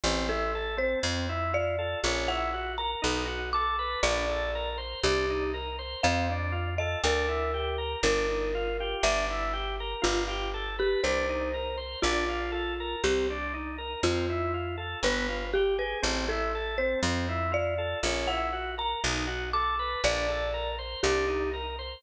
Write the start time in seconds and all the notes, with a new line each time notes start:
0.04 A1 C4
0.29 E4 A4
0.55 A4
0.77 C4 C5
1.03 F2 C4
1.29 E4
1.53 F4 D5
1.79 A4
2.04 A#1 C#4
2.28 E4 F#5
2.53 F#4
2.78 A#4 A#5
3.02 B1 D#4
3.27 F#4
3.53 A4 D6
3.79 B4
4.03 A#1 D4 D5
4.29 A4
4.55 A#4
4.78 C5
5.03 C2 D4 G4
5.30 D#4
5.54 A#4
5.79 C5
6.03 F2 C4 F5
6.30 D4
6.52 F4
6.78 A4 D#5
7.04 D2 D4 A#4
7.28 E4
7.54 G4
7.78 A#4
8.03 G1 D4 A#4
8.29 D#4
8.55 F4
8.80 G4
9.03 G1 D4 E5
9.30 E4
9.53 G4
9.80 A#4
10.02 G1 F4
10.28 G4
10.54 A4
10.79 G4 B4
11.04 C2 D4 C5
11.29 D#4
11.54 A#4
11.78 C5
12.02 A#1 D4 F4
12.29 F4
12.52 A4
12.80 A#4
13.04 C2 C4 G4
13.30 D4
13.54 D#4
13.78 A#4
14.03 F2 C4 F4
14.30 E4
14.54 F4
14.78 A4
15.03 G1 B3 B4
15.29 F4
15.54 G4
15.78 G#4 B4
16.02 A1 C4
16.29 E4 A4
16.55 A4
16.78 C4 C5
17.03 F2 C4
17.29 E4
17.52 F4 D5
17.78 A4
18.03 A#1 C#4
18.27 E4 F#5
18.53 F#4
18.78 A#4 A#5
19.04 B1 D#4
19.27 F#4
19.53 A4 D6
19.79 B4
20.04 A#1 D4 D5
20.28 A4
20.54 A#4
20.79 C5
21.03 C2 D4 G4
21.28 D#4
21.54 A#4
21.79 C5